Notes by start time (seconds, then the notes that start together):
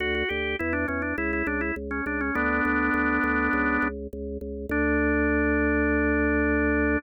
0.00 D2 F#4
0.15 F#4
0.29 D2 G4
0.59 E2 E4
0.73 D4
0.88 E2 C#4
1.02 D4
1.18 C#2 E4
1.33 E4
1.46 C#2 D4
1.61 E4
1.76 C#2
1.91 C#4
2.06 C#2 D4
2.21 C#4
2.35 D2 B3 D4
2.65 D2
2.94 D2
3.24 D2
3.53 C#2
3.82 C#2
4.13 C#2
4.41 C#2
4.69 D2 D4